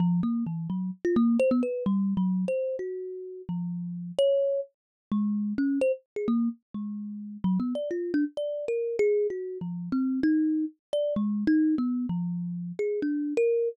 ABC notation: X:1
M:6/4
L:1/16
Q:1/4=129
K:none
V:1 name="Kalimba"
F,2 ^A,2 E,2 ^F,2 z =F A,2 c B, B2 (3G,4 ^F,4 c4 | ^F6 =F,6 ^c4 z4 ^G,4 | ^C2 =c z2 ^G ^A,2 z2 ^G,6 (3^F,2 B,2 d2 =F2 D z | (3d4 ^A4 ^G4 (3^F4 =F,4 C4 ^D4 z2 =d2 |
(3^G,4 ^D4 B,4 F,6 ^G2 =D3 ^A3 z2 |]